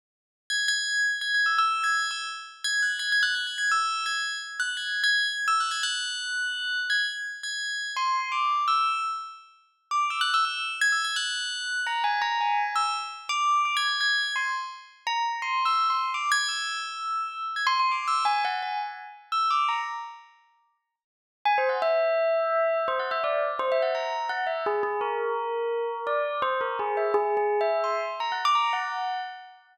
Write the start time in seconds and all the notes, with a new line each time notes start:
0.50 G#6
0.68 G#6
1.21 G#6
1.34 G#6
1.46 E6
1.58 E6
1.84 G#6
2.11 E6
2.64 G#6
2.82 F#6
2.99 G#6
3.12 G#6
3.23 F#6
3.35 G#6
3.47 G#6
3.58 G#6
3.71 E6
4.06 G#6
4.60 F#6
4.77 G#6
5.04 G#6
5.48 E6
5.60 F#6
5.71 G#6
5.83 F#6
6.90 G#6
7.43 G#6
7.96 C6
8.32 D6
8.68 E6
9.91 D6
10.10 E6
10.21 F#6
10.34 E6
10.45 E6
10.81 G#6
10.92 E6
11.04 G#6
11.16 F#6
11.87 A#5
12.04 G#5
12.22 A#5
12.41 G#5
12.76 E6
13.29 D6
13.65 D6
13.77 G#6
13.88 G#6
14.01 G#6
14.36 C6
15.07 A#5
15.42 C6
15.65 E6
15.90 C6
16.14 D6
16.32 G#6
16.48 E6
17.56 G#6
17.67 C6
17.80 C6
17.91 D6
18.08 E6
18.25 G#5
18.45 F#5
18.62 G#5
19.32 E6
19.50 D6
19.68 A#5
21.45 G#5
21.58 C5
21.69 F#5
21.82 E5
22.88 C5
22.99 F#5
23.11 E5
23.24 D5
23.59 C5
23.72 E5
23.82 F#5
23.95 A#5
24.29 F#5
24.47 E5
24.66 G#4
24.83 G#4
25.01 A#4
26.07 D5
26.42 C5
26.61 A#4
26.79 G#4
26.97 E5
27.14 G#4
27.37 G#4
27.61 E5
27.84 C6
28.20 A#5
28.32 F#5
28.45 D6
28.55 A#5
28.73 F#5